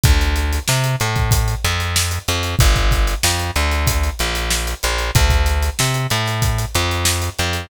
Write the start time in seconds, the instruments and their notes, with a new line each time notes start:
0.03 electric bass (finger) D2, kick, closed hi-hat
0.21 closed hi-hat
0.36 closed hi-hat
0.53 closed hi-hat
0.68 electric bass (finger) C3, snare
0.84 closed hi-hat
1.00 electric bass (finger) A2, closed hi-hat
1.16 kick, closed hi-hat
1.31 kick, closed hi-hat
1.48 closed hi-hat
1.64 electric bass (finger) F2, closed hi-hat
1.80 closed hi-hat
1.96 snare
2.11 closed hi-hat
2.28 electric bass (finger) F2, closed hi-hat
2.43 closed hi-hat
2.59 electric bass (finger) G1, kick, closed hi-hat
2.76 kick, closed hi-hat
2.91 kick, closed hi-hat
3.07 closed hi-hat
3.23 electric bass (finger) F2, snare
3.39 closed hi-hat
3.56 electric bass (finger) D2, closed hi-hat
3.71 snare, closed hi-hat
3.87 kick, closed hi-hat
4.03 closed hi-hat
4.19 electric bass (finger) A#1, closed hi-hat
4.35 closed hi-hat
4.51 snare
4.67 closed hi-hat
4.83 electric bass (finger) A#1, snare, closed hi-hat
4.98 closed hi-hat
5.15 electric bass (finger) D2, kick, closed hi-hat
5.30 kick, closed hi-hat
5.46 snare, closed hi-hat
5.63 closed hi-hat
5.79 electric bass (finger) C3, snare
5.94 closed hi-hat
6.10 electric bass (finger) A2, closed hi-hat
6.26 snare, closed hi-hat
6.42 kick, closed hi-hat
6.58 closed hi-hat
6.74 electric bass (finger) F2, closed hi-hat
6.91 closed hi-hat
7.05 snare
7.22 snare, closed hi-hat
7.39 electric bass (finger) F2, closed hi-hat
7.53 closed hi-hat